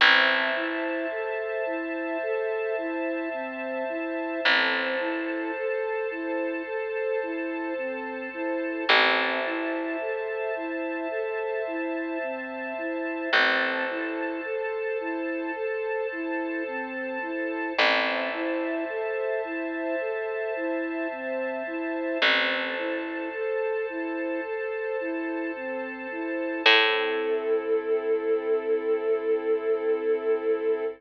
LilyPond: <<
  \new Staff \with { instrumentName = "Flute" } { \time 4/4 \key a \dorian \tempo 4 = 54 c'8 e'8 a'8 e'8 a'8 e'8 c'8 e'8 | c'8 e'8 a'8 e'8 a'8 e'8 c'8 e'8 | c'8 e'8 a'8 e'8 a'8 e'8 c'8 e'8 | c'8 e'8 a'8 e'8 a'8 e'8 c'8 e'8 |
c'8 e'8 a'8 e'8 a'8 e'8 c'8 e'8 | c'8 e'8 a'8 e'8 a'8 e'8 c'8 e'8 | a'1 | }
  \new Staff \with { instrumentName = "Electric Bass (finger)" } { \clef bass \time 4/4 \key a \dorian a,,1 | a,,1 | a,,1 | a,,1 |
a,,1 | a,,1 | a,1 | }
  \new Staff \with { instrumentName = "String Ensemble 1" } { \time 4/4 \key a \dorian <c'' e'' a''>1 | <a' c'' a''>1 | <c'' e'' a''>1 | <a' c'' a''>1 |
<c'' e'' a''>1 | <a' c'' a''>1 | <c' e' a'>1 | }
>>